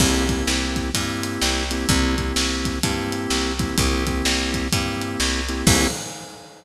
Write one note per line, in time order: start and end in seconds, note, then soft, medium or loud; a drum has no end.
0.00 0.43 C2 loud
0.00 0.26 A#3 medium
0.00 0.26 C4 medium
0.00 0.26 E4 medium
0.00 0.26 G4 medium
0.00 kick medium
0.00 crash medium
0.29 0.90 A#3 medium
0.29 0.90 C4 medium
0.29 0.90 E4 medium
0.29 0.90 G4 medium
0.29 kick medium
0.29 closed hi-hat medium
0.47 0.91 C2 medium
0.47 snare medium
0.76 kick medium
0.76 closed hi-hat medium
0.94 1.38 G2 medium
0.94 1.64 A#3 medium
0.94 1.64 C4 medium
0.94 1.64 E4 medium
0.94 1.64 G4 medium
0.94 kick medium
0.94 closed hi-hat medium
1.23 closed hi-hat medium
1.42 1.85 C2 medium
1.42 snare medium
1.71 1.88 A#3 medium
1.71 1.88 C4 medium
1.71 1.88 E4 medium
1.71 1.88 G4 medium
1.71 closed hi-hat medium
1.89 2.33 C2 loud
1.89 2.15 A#3 medium
1.89 2.15 C4 medium
1.89 2.15 E4 medium
1.89 2.15 G4 medium
1.89 kick medium
1.89 closed hi-hat medium
2.17 2.79 A#3 medium
2.17 2.79 C4 medium
2.17 2.79 E4 medium
2.17 2.79 G4 medium
2.17 kick medium
2.17 closed hi-hat medium
2.36 2.80 C2 medium
2.36 snare medium
2.65 kick medium
2.65 closed hi-hat medium
2.83 3.27 G2 medium
2.83 3.53 A#3 medium
2.83 3.53 C4 medium
2.83 3.53 E4 medium
2.83 3.53 G4 medium
2.83 kick medium
2.83 closed hi-hat medium
3.12 closed hi-hat medium
3.30 3.74 C2 medium
3.30 snare medium
3.59 3.76 A#3 medium
3.59 3.76 C4 medium
3.59 3.76 E4 medium
3.59 3.76 G4 medium
3.59 kick medium
3.59 closed hi-hat medium
3.78 4.22 C2 medium
3.78 4.04 A#3 medium
3.78 4.04 C4 medium
3.78 4.04 E4 medium
3.78 4.04 G4 medium
3.78 kick medium
3.78 closed hi-hat medium
4.07 4.68 A#3 medium
4.07 4.68 C4 medium
4.07 4.68 E4 medium
4.07 4.68 G4 medium
4.07 kick medium
4.07 closed hi-hat medium
4.25 4.69 C2 medium
4.25 snare medium
4.54 kick medium
4.54 closed hi-hat medium
4.72 5.17 G2 medium
4.72 5.42 A#3 medium
4.72 5.42 C4 medium
4.72 5.42 E4 medium
4.72 5.42 G4 medium
4.72 kick medium
4.72 closed hi-hat medium
5.01 closed hi-hat medium
5.20 5.63 C2 medium
5.20 snare medium
5.49 5.66 A#3 medium
5.49 5.66 C4 medium
5.49 5.66 E4 medium
5.49 5.66 G4 medium
5.49 closed hi-hat medium
5.67 5.87 C2 loud
5.67 5.87 A#3 loud
5.67 5.87 C4 loud
5.67 5.87 E4 loud
5.67 5.87 G4 loud
5.67 kick loud
5.67 crash loud